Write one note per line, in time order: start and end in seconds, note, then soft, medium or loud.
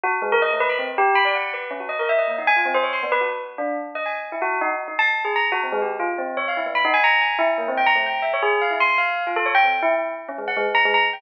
0.03 0.12 F#4 loud
0.22 0.30 G#3 loud
0.32 0.41 A#4 loud
0.42 0.50 D#5 medium
0.51 0.59 A3 medium
0.60 0.69 B4 loud
0.69 0.78 B5 medium
0.79 0.87 C4 medium
0.98 1.15 G4 loud
1.15 1.24 B5 loud
1.25 1.33 D5 medium
1.35 1.52 F#5 medium
1.54 1.70 B4 medium
1.71 1.79 C#4 medium
1.80 1.88 F#4 medium
1.89 1.97 D#5 medium
1.99 2.08 A#4 medium
2.09 2.17 E5 medium
2.19 2.27 D#5 medium
2.28 2.36 A#3 medium
2.38 2.47 D#4 medium
2.47 2.56 G#5 loud
2.56 2.65 F4 medium
2.65 2.74 C4 medium
2.74 2.83 C5 loud
2.83 2.92 C#5 medium
2.93 3.01 C6 medium
3.03 3.11 B3 medium
3.12 3.20 B4 loud
3.21 3.29 F#4 medium
3.58 3.75 D4 medium
3.95 4.04 D#5 medium
4.06 4.14 G#5 soft
4.32 4.40 E4 medium
4.42 4.58 F#4 loud
4.61 4.70 D#4 loud
4.88 4.96 D#4 medium
4.99 5.07 A5 loud
5.25 5.33 G#4 medium
5.36 5.44 A#5 medium
5.52 5.60 F#4 loud
5.63 5.72 C4 medium
5.72 5.81 G#3 loud
5.82 5.90 G4 medium
5.99 6.08 F4 medium
6.18 6.35 C4 medium
6.37 6.45 C#5 medium
6.48 6.56 F5 medium
6.57 6.65 E4 medium
6.66 6.74 B3 medium
6.75 6.83 B5 medium
6.85 6.93 D#4 loud
6.94 7.02 G#5 loud
7.04 7.21 A#5 loud
7.21 7.38 G#5 medium
7.39 7.47 E4 loud
7.58 7.66 A#3 medium
7.68 7.76 C4 medium
7.77 7.86 G5 medium
7.86 7.95 A#5 loud
7.95 8.04 A3 medium
8.06 8.23 G5 medium
8.22 8.31 E5 soft
8.33 8.42 C#5 medium
8.42 8.59 G#4 loud
8.61 8.70 F5 medium
8.71 8.79 E4 medium
8.80 8.97 C6 medium
8.98 9.23 F5 medium
9.27 9.35 F4 medium
9.36 9.45 A4 loud
9.46 9.54 C#5 medium
9.55 9.63 G5 loud
9.64 9.72 C4 soft
9.82 9.91 E4 loud
10.28 10.37 C#4 medium
10.38 10.47 G#3 medium
10.48 10.56 F#5 medium
10.57 10.65 G#3 loud
10.75 10.83 A#5 loud
10.85 10.93 G#3 loud
10.94 11.02 A#5 loud
11.13 11.21 G5 medium